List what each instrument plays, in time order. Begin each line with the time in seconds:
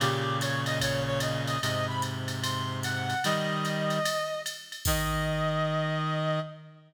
0.00 clarinet A#2 C#3 G4, ride
0.41 clarinet C#5, hi-hat pedal, ride
0.66 clarinet D#5, ride
0.80 clarinet C#5, kick, ride
1.07 clarinet C#5
1.20 clarinet D#5, hi-hat pedal, ride
1.47 clarinet D#5, ride
1.62 clarinet G#2 C3 D#5, ride
1.88 clarinet B5
2.02 hi-hat pedal, ride
2.28 ride
2.43 clarinet C6, ride
2.83 clarinet F#5, hi-hat pedal, ride
3.10 ride
3.24 clarinet D#3 G3 D#5, ride
3.65 hi-hat pedal, ride
3.90 hi-hat pedal, ride
4.05 ride
4.46 hi-hat pedal, ride
4.72 ride
4.85 clarinet D#3 D#5, kick, crash